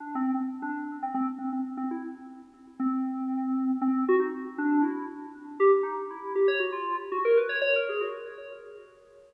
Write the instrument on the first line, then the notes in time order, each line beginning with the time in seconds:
electric piano 2
0.00 D4
0.15 C4
0.34 C4
0.62 D4
1.03 C4
1.14 C4
1.38 C4
1.53 C4
1.77 C4
1.91 E4
2.80 C4
3.81 C4
4.08 F#4
4.19 D#4
4.58 D4
4.82 E4
5.60 G4
5.83 D#4
6.10 E4
6.35 G4
6.48 C#5
6.60 F#4
6.72 F4
7.12 F#4
7.25 A#4
7.37 B4
7.49 C#5
7.61 C#5
7.76 A#4
7.89 G#4
8.01 F#4